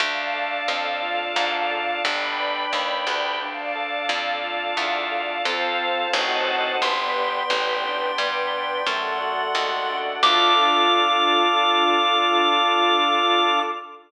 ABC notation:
X:1
M:5/4
L:1/8
Q:1/4=88
K:Ddor
V:1 name="Lead 1 (square)"
z10 | z10 | c'10 | d'10 |]
V:2 name="Drawbar Organ"
D A D F D A D B D G | D A D F D A [CFA]2 [C_E^FA]2 | B, G B, D B, G A, ^F A, D | [DFA]10 |]
V:3 name="Electric Bass (finger)" clef=bass
D,,2 F,,2 _A,,2 G,,,2 _E,, D,,- | D,,2 F,,2 E,,2 F,,2 A,,,2 | G,,,2 A,,,2 G,,2 ^F,,2 _E,,2 | D,,10 |]
V:4 name="String Ensemble 1"
[dfa]6 [dgb]4 | [dfa]6 [cfa]2 [c_e^fa]2 | [Bdg]6 [Ad^f]4 | [DFA]10 |]